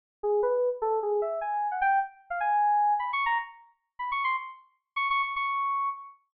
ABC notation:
X:1
M:5/8
L:1/16
Q:1/4=152
K:none
V:1 name="Electric Piano 2"
z2 _A2 | B3 z A2 _A2 e2 | _a3 _g =g2 z3 f | _a6 (3b2 _d'2 _b2 |
z6 (3b2 _d'2 c'2 | z6 (3_d'2 d'2 d'2 | _d'6 z4 |]